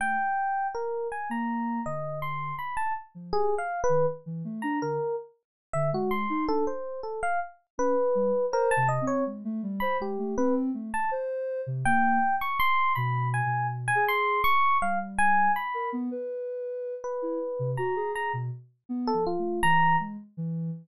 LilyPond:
<<
  \new Staff \with { instrumentName = "Electric Piano 1" } { \time 7/8 \tempo 4 = 81 g''4 bes'8 aes''16 bes''8. ees''8 c'''8 | b''16 a''16 r8 \tuplet 3/2 { aes'8 f''8 b'8 } r8. bes''16 bes'8 | r8. e''16 ges'16 c'''8 a'16 c''8 a'16 f''16 r8 | b'4 bes'16 a''16 ees''16 des''16 r8. b''16 g'8 |
b'16 r8 a''16 r4 g''8. des'''16 c'''8 | b''8 aes''8 r16 aes''16 c'''8 des'''8 f''16 r16 aes''8 | b''8 r4. b'4 bes''8 | bes''16 r4 a'16 f'8 bes''8 r4 | }
  \new Staff \with { instrumentName = "Ocarina" } { \time 7/8 a16 r4. bes8. d4 | r8. f16 g'16 r8 ees16 r16 e16 a16 d'16 d16 r16 | r8. d16 aes8 ees'16 d'16 r4. | des'16 r16 g16 r16 \tuplet 3/2 { c''8 c8 c'8 } aes16 a16 g16 c''16 aes16 a16 |
c'8 a16 r16 c''8. c16 bes8 r4 | \tuplet 3/2 { b,4 b,4 aes'4 } r8 g4 | r16 bes'16 b16 b'4~ b'16 r16 e'16 r16 c16 ges'16 aes'16 | aes'16 b,16 r8 \tuplet 3/2 { b8 f8 a8 } e8 aes16 r16 e8 | }
>>